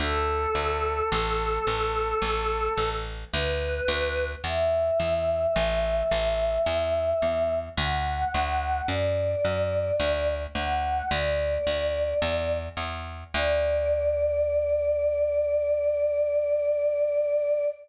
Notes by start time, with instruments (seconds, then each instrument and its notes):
0.00 electric bass (finger) D2, choir aahs A4
0.55 electric bass (finger) D2
1.12 electric bass (finger) A1
1.67 electric bass (finger) A1
2.22 electric bass (finger) A1
2.78 electric bass (finger) A1
3.32 electric bass (finger) D2, choir aahs B4
3.88 electric bass (finger) D2
4.44 electric bass (finger) E2, choir aahs E5
5.00 electric bass (finger) E2
5.56 electric bass (finger) A1
6.11 electric bass (finger) A1
6.66 electric bass (finger) E2
7.22 electric bass (finger) E2
7.77 electric bass (finger) D2, choir aahs F#5
8.34 electric bass (finger) D2
8.87 electric bass (finger) F#2, choir aahs D5
9.45 electric bass (finger) F#2
10.00 electric bass (finger) D2
10.55 electric bass (finger) D2, choir aahs F#5
11.11 electric bass (finger) D2, choir aahs D5
11.67 electric bass (finger) D2
12.22 electric bass (finger) E2
12.77 electric bass (finger) E2
13.34 electric bass (finger) D2, choir aahs D5